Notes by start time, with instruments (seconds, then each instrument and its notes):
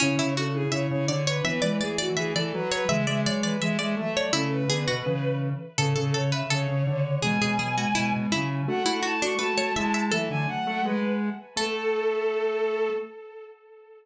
0.00 lead 1 (square) C#3, pizzicato strings C#4, ocarina C#4 E4, violin C#5
0.17 lead 1 (square) C#3, pizzicato strings E4
0.36 ocarina D4, pizzicato strings F#4, violin A4
0.54 ocarina E4, violin G#4
0.71 lead 1 (square) C#3, ocarina E4, violin C#5, pizzicato strings E5
0.90 lead 1 (square) C#3, violin C#5
1.08 lead 1 (square) D3, ocarina D4, violin C#5, pizzicato strings D5
1.27 violin B4, pizzicato strings C#5
1.44 lead 1 (square) E3, ocarina B3, violin B4, pizzicato strings E5
1.62 lead 1 (square) E3, ocarina G#3, pizzicato strings D5
1.81 ocarina A3, violin G#4, pizzicato strings D5
1.98 violin F#4, pizzicato strings D5
2.17 lead 1 (square) E3, violin G#4, pizzicato strings E5
2.35 lead 1 (square) E3, violin A4, pizzicato strings D5
2.53 lead 1 (square) F#3, violin B4
2.72 violin B4, pizzicato strings C#5
2.89 ocarina C#3 E3, lead 1 (square) G#3, pizzicato strings E5, violin E5
3.07 lead 1 (square) G#3, pizzicato strings D5
3.25 ocarina F#3, violin C#5, pizzicato strings D5
3.43 ocarina E3, violin B4, pizzicato strings D5
3.61 ocarina E3, lead 1 (square) G#3, pizzicato strings E5, violin E5
3.79 lead 1 (square) G#3, pizzicato strings D5, violin E5
3.96 ocarina F#3, lead 1 (square) A3, violin E5
4.16 pizzicato strings C#5, violin D5
4.33 lead 1 (square) C#3, ocarina A3 C#4, pizzicato strings E4, violin A4
4.52 violin B4
4.68 lead 1 (square) D3, ocarina B3, pizzicato strings G#4
4.88 lead 1 (square) B2, pizzicato strings F#4
5.06 lead 1 (square) C#3, ocarina E3
5.78 ocarina A2 C#3, lead 1 (square) C#3, pizzicato strings A4, violin A4
5.96 lead 1 (square) C#3, pizzicato strings A4
6.14 ocarina C#3, pizzicato strings A4, violin C#5
6.32 ocarina C#3, pizzicato strings B4, violin E5
6.50 ocarina C#3, lead 1 (square) C#3, pizzicato strings A4, violin C#5
6.68 lead 1 (square) C#3
6.86 ocarina C#3, lead 1 (square) D3
7.22 lead 1 (square) B2, ocarina E3 G#3, pizzicato strings G#4, violin G#5
7.41 lead 1 (square) B2, pizzicato strings G#4
7.59 ocarina F#3, pizzicato strings G#4
7.77 ocarina G#3, pizzicato strings F#4
7.95 lead 1 (square) B2, ocarina G#3, pizzicato strings E4
8.12 lead 1 (square) B2
8.31 lead 1 (square) C#3, ocarina F#3, pizzicato strings E4
8.67 lead 1 (square) A3, ocarina D4 F#4, violin F#5
8.86 lead 1 (square) A3, pizzicato strings E4
9.03 ocarina E4, pizzicato strings F#4, violin A5
9.22 pizzicato strings D4, ocarina F#4, violin C#6
9.39 lead 1 (square) A3, ocarina F#4, pizzicato strings B4, violin A5
9.58 lead 1 (square) A3, pizzicato strings C#5
9.76 lead 1 (square) G#3, ocarina E4, pizzicato strings E5
9.94 pizzicato strings E5
10.12 lead 1 (square) E3, ocarina F#3 A3, pizzicato strings A4, violin E5
10.30 lead 1 (square) D3, violin G#5
10.48 violin F#5
10.66 lead 1 (square) A3
10.84 lead 1 (square) G#3, violin B4
11.56 lead 1 (square) A3, ocarina A3, violin A4, pizzicato strings A4